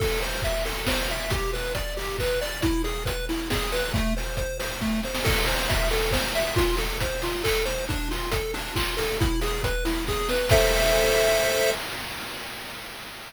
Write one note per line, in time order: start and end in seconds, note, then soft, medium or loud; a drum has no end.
0.00 0.20 A4 medium
0.00 kick medium
0.00 crash medium
0.21 0.42 C5 medium
0.21 open hi-hat medium
0.42 0.64 E5 medium
0.42 kick medium
0.42 closed hi-hat medium
0.65 0.85 A4 medium
0.65 open hi-hat medium
0.86 1.08 C5 medium
0.86 kick medium
0.86 snare medium
1.08 1.30 E5 medium
1.08 open hi-hat medium
1.30 1.51 G4 medium
1.30 kick medium
1.30 closed hi-hat medium
1.53 1.73 B4 medium
1.53 open hi-hat medium
1.75 1.94 D5 medium
1.75 kick medium
1.75 closed hi-hat medium
1.97 2.17 G4 medium
1.97 open hi-hat medium
2.19 2.40 B4 medium
2.19 kick medium
2.19 clap medium
2.41 2.61 D5 medium
2.41 open hi-hat medium
2.62 2.82 E4 medium
2.62 kick medium
2.62 closed hi-hat medium
2.84 3.04 G#4 medium
2.84 open hi-hat medium
3.05 3.26 B4 medium
3.05 kick medium
3.05 closed hi-hat medium
3.29 3.49 E4 medium
3.29 open hi-hat medium
3.50 3.70 G#4 medium
3.50 kick medium
3.50 snare medium
3.72 3.92 B4 medium
3.72 open hi-hat medium
3.94 4.14 A3 medium
3.94 kick medium
3.94 closed hi-hat medium
4.17 4.36 C5 medium
4.17 open hi-hat medium
4.37 4.58 C5 medium
4.37 kick medium
4.37 closed hi-hat medium
4.59 4.79 C5 medium
4.59 open hi-hat medium
4.81 5.01 A3 medium
4.81 kick medium
4.81 snare medium
5.03 5.24 C5 medium
5.03 snare medium
5.15 snare medium
5.24 5.44 A4 loud
5.24 kick medium
5.24 crash loud
5.46 5.67 C5 medium
5.46 open hi-hat medium
5.69 5.89 E5 medium
5.69 kick medium
5.69 closed hi-hat medium
5.91 6.11 A4 medium
5.91 open hi-hat medium
6.11 6.32 C5 medium
6.11 kick medium
6.11 snare medium
6.35 6.55 E5 medium
6.35 open hi-hat medium
6.56 6.76 F4 medium
6.56 kick medium
6.56 closed hi-hat loud
6.77 6.98 A4 medium
6.77 open hi-hat medium
7.00 7.21 C5 medium
7.00 kick medium
7.00 closed hi-hat medium
7.22 7.42 F4 medium
7.22 open hi-hat medium
7.44 7.64 A4 medium
7.44 kick medium
7.44 clap loud
7.65 7.85 C5 medium
7.65 open hi-hat medium
7.89 8.08 D4 medium
7.89 kick medium
7.89 closed hi-hat medium
8.11 8.30 F4 medium
8.11 open hi-hat medium
8.31 8.51 A4 medium
8.31 kick medium
8.31 closed hi-hat loud
8.54 8.74 D4 medium
8.54 open hi-hat medium
8.75 8.95 F4 medium
8.75 kick medium
8.75 clap loud
8.97 9.17 A4 medium
8.97 open hi-hat medium
9.20 9.40 E4 medium
9.20 kick loud
9.20 closed hi-hat medium
9.41 9.62 G#4 medium
9.41 open hi-hat medium
9.63 9.84 B4 medium
9.63 kick medium
9.63 closed hi-hat medium
9.85 10.05 E4 medium
9.85 open hi-hat medium
10.07 10.28 G#4 medium
10.07 kick medium
10.07 snare medium
10.29 10.49 B4 medium
10.29 snare medium
10.49 11.71 A4 loud
10.49 11.71 C5 loud
10.49 11.71 E5 loud
10.49 kick loud
10.49 crash loud